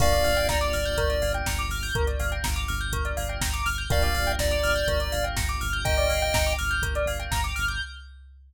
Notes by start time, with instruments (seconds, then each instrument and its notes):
0.00 synth bass 1 G1, electric piano 1 A#3 D4 F4 G4, tubular bells A#4, lead 1 (square) D5 F5, kick, crash
0.12 tubular bells D5, closed hi-hat
0.24 synth bass 1 G1, tubular bells F5, open hi-hat
0.37 tubular bells G5, closed hi-hat
0.49 synth bass 1 G1, lead 1 (square) D5, tubular bells A#5, kick, snare
0.61 tubular bells D6, closed hi-hat
0.73 synth bass 1 G1, tubular bells F6, open hi-hat
0.85 tubular bells G6, closed hi-hat
0.97 synth bass 1 G1, tubular bells A#4, kick, closed hi-hat
1.10 tubular bells D5, closed hi-hat
1.21 synth bass 1 G1, tubular bells F5, open hi-hat
1.34 tubular bells G5, closed hi-hat
1.46 synth bass 1 G1, tubular bells A#5, kick, snare
1.59 tubular bells D6, closed hi-hat
1.69 synth bass 1 G1, tubular bells F6, open hi-hat
1.83 tubular bells G6, open hi-hat
1.95 synth bass 1 G1, tubular bells A#4, kick, closed hi-hat
2.07 tubular bells D5, closed hi-hat
2.20 synth bass 1 G1, tubular bells F5, open hi-hat
2.32 tubular bells G5, closed hi-hat
2.44 synth bass 1 G1, tubular bells A#5, kick, snare
2.56 tubular bells D6, closed hi-hat
2.68 synth bass 1 G1, tubular bells F6, open hi-hat
2.80 tubular bells G6, closed hi-hat
2.92 synth bass 1 G1, tubular bells A#4, kick, closed hi-hat
3.05 tubular bells D5, closed hi-hat
3.17 synth bass 1 G1, tubular bells F5, open hi-hat
3.29 tubular bells G5, closed hi-hat
3.41 synth bass 1 G1, tubular bells A#5, kick, snare
3.53 tubular bells D6, closed hi-hat
3.65 synth bass 1 G1, tubular bells F6, open hi-hat
3.78 tubular bells G6, closed hi-hat
3.90 synth bass 1 G1, electric piano 1 A#3 D4 F4 G4, tubular bells A#4, lead 1 (square) D5 F5, kick, closed hi-hat
4.02 tubular bells D5, closed hi-hat
4.15 synth bass 1 G1, tubular bells F5, open hi-hat
4.27 tubular bells G5, closed hi-hat
4.39 synth bass 1 G1, lead 1 (square) D5, tubular bells A#5, kick, snare
4.51 tubular bells D6, closed hi-hat
4.63 synth bass 1 G1, tubular bells F6, open hi-hat
4.75 tubular bells G6, closed hi-hat
4.88 synth bass 1 G1, tubular bells A#4, kick, closed hi-hat
5.00 tubular bells D5, closed hi-hat
5.12 synth bass 1 G1, tubular bells F5, open hi-hat
5.24 tubular bells G5, closed hi-hat
5.36 synth bass 1 G1, tubular bells A#5, kick, snare
5.49 tubular bells D6, closed hi-hat
5.61 synth bass 1 G1, tubular bells F6, open hi-hat
5.73 tubular bells G6, closed hi-hat
5.85 synth bass 1 G1, tubular bells A#4, lead 1 (square) D#5 G5, kick, closed hi-hat
5.97 tubular bells D5, closed hi-hat
6.09 synth bass 1 G1, tubular bells F5, open hi-hat
6.22 tubular bells G5, closed hi-hat
6.34 synth bass 1 G1, tubular bells A#5, kick, snare
6.46 tubular bells D6, closed hi-hat
6.59 synth bass 1 G1, tubular bells F6, open hi-hat
6.71 tubular bells G6, closed hi-hat
6.82 synth bass 1 G1, tubular bells A#4, kick, closed hi-hat
6.95 tubular bells D5, closed hi-hat
7.06 synth bass 1 G1, tubular bells F5, open hi-hat
7.20 tubular bells G5, closed hi-hat
7.31 synth bass 1 G1, tubular bells A#5, kick, snare
7.44 tubular bells D6, closed hi-hat
7.56 synth bass 1 G1, tubular bells F6, open hi-hat
7.68 tubular bells G6, closed hi-hat